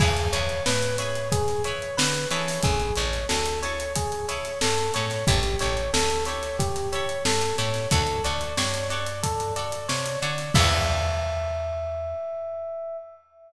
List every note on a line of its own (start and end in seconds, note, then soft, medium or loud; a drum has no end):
0.00 0.28 E2 medium
0.00 0.12 E4 medium
0.00 0.30 G#4 medium
0.00 0.12 G#4 medium
0.00 0.12 B4 medium
0.00 0.12 C#5 medium
0.00 kick loud
0.00 crash medium
0.17 closed hi-hat medium
0.33 0.61 E2 medium
0.33 0.56 E4 medium
0.33 0.56 G#4 medium
0.33 0.56 B4 medium
0.33 0.63 C#5 medium
0.33 0.56 C#5 medium
0.33 closed hi-hat medium
0.49 closed hi-hat medium
0.66 1.80 A2 medium
0.66 0.96 B4 medium
0.66 snare loud
0.82 closed hi-hat medium
0.98 1.22 E4 medium
0.98 1.22 G#4 medium
0.98 1.22 B4 medium
0.98 1.29 C#5 medium
0.98 1.22 C#5 medium
0.98 closed hi-hat medium
1.15 closed hi-hat medium
1.32 1.62 G#4 medium
1.32 kick medium
1.32 closed hi-hat medium
1.48 snare soft
1.48 closed hi-hat medium
1.64 1.88 E4 medium
1.64 1.88 G#4 medium
1.64 1.88 B4 medium
1.64 1.95 C#5 medium
1.64 1.88 C#5 medium
1.64 closed hi-hat medium
1.82 closed hi-hat medium
1.97 2.26 D3 medium
1.97 2.28 B4 medium
1.97 snare loud
2.14 closed hi-hat medium
2.31 2.59 E3 medium
2.31 2.75 E4 medium
2.31 2.75 G#4 medium
2.31 2.75 A4 medium
2.31 2.61 C#5 medium
2.31 2.75 C#5 medium
2.31 closed hi-hat medium
2.48 snare soft
2.48 open hi-hat medium
2.63 2.92 A1 medium
2.63 2.94 G#4 medium
2.63 kick medium
2.63 closed hi-hat medium
2.80 closed hi-hat medium
2.96 3.25 A1 medium
2.96 3.20 E4 medium
2.96 3.20 G#4 medium
2.96 3.20 A4 medium
2.96 3.27 C#5 medium
2.96 closed hi-hat medium
3.00 3.20 C#5 medium
3.13 snare soft
3.13 closed hi-hat medium
3.29 4.42 D2 medium
3.29 3.59 A4 medium
3.29 snare medium
3.46 closed hi-hat medium
3.63 3.86 E4 medium
3.63 3.86 G#4 medium
3.63 3.86 A4 medium
3.63 3.93 C#5 medium
3.63 3.86 C#5 medium
3.63 closed hi-hat medium
3.80 closed hi-hat medium
3.95 4.26 G#4 medium
3.95 kick medium
3.95 closed hi-hat loud
4.12 closed hi-hat medium
4.28 4.52 E4 medium
4.28 4.52 G#4 medium
4.28 4.52 A4 medium
4.28 4.59 C#5 medium
4.28 4.52 C#5 medium
4.28 closed hi-hat medium
4.45 snare soft
4.45 closed hi-hat medium
4.61 4.91 G2 medium
4.61 4.92 A4 medium
4.61 snare loud
4.78 closed hi-hat medium
4.94 5.24 A2 medium
4.94 5.06 E4 medium
4.94 5.06 G#4 medium
4.94 5.06 A4 medium
4.94 5.25 C#5 medium
4.94 5.06 C#5 medium
4.94 closed hi-hat medium
5.10 snare soft
5.10 closed hi-hat medium
5.27 5.56 A1 medium
5.27 5.39 E4 medium
5.27 5.58 G4 medium
5.27 5.39 G4 medium
5.27 5.39 A4 medium
5.27 5.39 C#5 medium
5.27 kick medium
5.27 closed hi-hat medium
5.43 snare soft
5.43 closed hi-hat medium
5.59 5.89 A1 medium
5.59 5.83 E4 medium
5.59 5.83 G4 medium
5.59 5.83 A4 medium
5.59 5.91 C#5 medium
5.59 5.83 C#5 medium
5.59 closed hi-hat medium
5.77 closed hi-hat medium
5.93 7.06 D2 medium
5.93 6.24 A4 medium
5.93 snare loud
6.10 closed hi-hat medium
6.25 6.50 E4 medium
6.25 6.50 G4 medium
6.25 6.50 A4 medium
6.25 6.56 C#5 medium
6.25 6.50 C#5 medium
6.25 closed hi-hat medium
6.43 snare soft
6.43 closed hi-hat medium
6.59 6.89 G4 medium
6.59 kick medium
6.59 closed hi-hat medium
6.76 snare soft
6.76 closed hi-hat medium
6.92 7.16 E4 medium
6.92 7.16 G4 medium
6.92 7.16 A4 medium
6.92 7.23 C#5 medium
6.92 7.16 C#5 medium
6.92 closed hi-hat medium
7.09 closed hi-hat medium
7.25 7.53 G2 medium
7.25 7.56 A4 medium
7.25 snare loud
7.41 closed hi-hat medium
7.58 7.87 A2 medium
7.58 7.70 E4 medium
7.58 7.70 G4 medium
7.58 7.70 A4 medium
7.58 7.88 C#5 medium
7.58 7.70 C#5 medium
7.58 closed hi-hat medium
7.74 snare soft
7.74 closed hi-hat medium
7.91 8.20 D2 medium
7.91 8.03 F#4 loud
7.91 8.22 A4 medium
7.91 8.03 A4 medium
7.91 8.03 C#5 medium
7.91 8.03 D5 medium
7.91 kick medium
7.91 closed hi-hat medium
8.07 closed hi-hat medium
8.24 8.53 D2 medium
8.24 8.47 F#4 medium
8.24 8.47 A4 medium
8.24 8.47 C#5 medium
8.24 8.55 D5 medium
8.24 8.47 D5 medium
8.24 closed hi-hat medium
8.41 closed hi-hat medium
8.57 9.70 G2 medium
8.57 8.88 C#5 medium
8.57 snare medium
8.74 closed hi-hat medium
8.90 9.13 F#4 medium
8.90 9.13 A4 medium
8.90 9.13 C#5 medium
8.90 9.20 D5 medium
8.90 9.13 D5 medium
8.90 closed hi-hat medium
9.06 closed hi-hat medium
9.23 9.53 A4 medium
9.23 kick medium
9.23 closed hi-hat medium
9.40 closed hi-hat medium
9.56 9.79 F#4 medium
9.56 9.79 A4 medium
9.56 9.79 C#5 medium
9.56 9.86 D5 medium
9.56 9.79 D5 medium
9.56 closed hi-hat medium
9.72 closed hi-hat medium
9.88 10.17 C3 medium
9.88 10.19 C#5 medium
9.88 snare medium
10.06 closed hi-hat medium
10.22 10.50 D3 medium
10.22 10.34 F#4 medium
10.22 10.34 A4 medium
10.22 10.34 C#5 medium
10.22 10.53 D5 medium
10.22 10.34 D5 medium
10.22 closed hi-hat medium
10.38 snare soft
10.38 closed hi-hat medium
10.54 12.97 E2 loud
10.54 12.97 E4 loud
10.54 12.97 G#4 loud
10.54 12.97 B4 loud
10.54 12.97 C#5 loud
10.54 12.97 E5 loud
10.54 kick loud
10.54 crash loud